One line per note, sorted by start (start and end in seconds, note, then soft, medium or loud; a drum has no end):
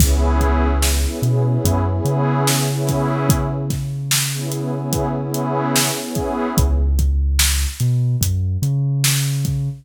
0.00 1.06 C#2 medium
0.00 0.67 B3 loud
0.00 0.67 C#4 loud
0.00 0.67 E4 loud
0.00 0.67 G#4 loud
0.00 kick loud
0.00 crash loud
0.41 kick medium
0.41 closed hi-hat medium
0.82 snare loud
1.05 1.19 B3 medium
1.05 1.19 C#4 medium
1.05 1.19 E4 loud
1.05 1.19 G#4 medium
1.22 1.58 B2 medium
1.22 1.42 B3 medium
1.22 1.42 C#4 medium
1.22 1.42 E4 medium
1.22 1.42 G#4 medium
1.22 closed hi-hat medium
1.46 1.78 B3 medium
1.46 1.78 C#4 medium
1.46 1.78 E4 medium
1.46 1.78 G#4 medium
1.65 2.00 F#2 medium
1.65 kick loud
1.65 closed hi-hat loud
1.87 2.51 B3 medium
1.87 2.51 C#4 medium
1.87 2.51 E4 medium
1.87 2.51 G#4 medium
2.05 5.91 C#3 medium
2.05 closed hi-hat medium
2.47 snare loud
2.70 3.33 B3 medium
2.70 3.33 C#4 loud
2.70 3.33 E4 loud
2.70 3.33 G#4 medium
2.87 kick medium
2.87 snare soft
2.87 closed hi-hat medium
3.29 kick loud
3.29 closed hi-hat loud
3.70 kick loud
3.70 snare soft
3.70 closed hi-hat medium
4.11 snare loud
4.34 4.49 B3 medium
4.34 4.49 C#4 medium
4.34 4.49 E4 medium
4.34 4.49 G#4 medium
4.52 4.70 B3 medium
4.52 4.70 C#4 medium
4.52 4.70 E4 medium
4.52 4.70 G#4 medium
4.52 closed hi-hat medium
4.75 5.07 B3 medium
4.75 5.07 C#4 medium
4.75 5.07 E4 medium
4.75 5.07 G#4 medium
4.93 kick loud
4.93 closed hi-hat loud
5.16 5.80 B3 medium
5.16 5.80 C#4 medium
5.16 5.80 E4 medium
5.16 5.80 G#4 medium
5.34 closed hi-hat medium
5.76 snare loud
5.99 6.47 B3 medium
5.99 6.47 C#4 medium
5.99 6.47 E4 medium
5.99 6.47 G#4 medium
6.15 kick loud
6.15 closed hi-hat medium
6.58 7.66 C#2 medium
6.58 kick loud
6.58 closed hi-hat loud
6.99 kick medium
6.99 closed hi-hat medium
7.39 snare loud
7.80 8.16 B2 medium
7.80 closed hi-hat medium
8.21 8.57 F#2 medium
8.21 kick medium
8.21 closed hi-hat loud
8.62 9.69 C#3 medium
8.62 closed hi-hat medium
9.04 snare loud
9.45 kick loud
9.45 closed hi-hat medium